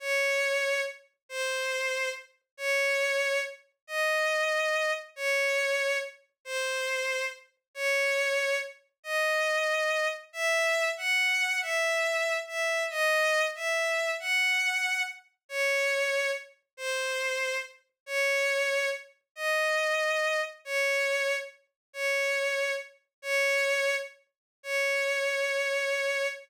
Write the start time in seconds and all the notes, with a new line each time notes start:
0.00 C#5
1.29 C5
2.57 C#5
3.87 D#5
5.16 C#5
6.45 C5
7.75 C#5
9.03 D#5
10.33 E5
10.97 F#5
11.61 E5
12.48 E5
12.90 D#5
13.55 E5
14.20 F#5
15.49 C#5
16.77 C5
18.06 C#5
19.36 D#5
20.65 C#5
21.93 C#5
23.22 C#5
24.63 C#5